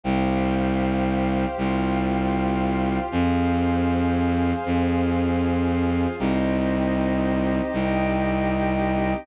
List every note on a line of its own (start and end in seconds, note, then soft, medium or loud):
0.04 1.46 C2 loud
0.04 1.56 G4 loud
0.04 1.56 C5 medium
0.04 3.09 C5 medium
0.04 1.56 F5 medium
0.04 3.09 F5 medium
0.04 3.09 G5 medium
1.58 2.99 C2 loud
1.58 3.10 F4 loud
1.58 3.10 G4 medium
1.58 3.10 F5 medium
3.12 4.53 F2 loud
3.12 4.64 G#4 medium
3.12 4.64 C5 medium
3.12 6.16 C5 medium
3.12 4.64 F5 medium
3.12 6.16 F5 medium
3.12 6.16 G#5 medium
4.66 6.07 F2 loud
4.66 6.18 F4 medium
4.66 6.18 G#4 medium
4.66 6.18 F5 medium
6.19 7.61 C2 loud
6.19 9.24 C4 medium
6.19 9.24 D#4 medium
6.19 9.24 G4 medium
6.19 7.72 G4 medium
6.19 7.72 C5 medium
6.19 7.72 D#5 medium
7.73 9.15 C2 loud
7.73 9.26 G4 loud
7.73 9.26 D#5 loud
7.73 9.26 G5 medium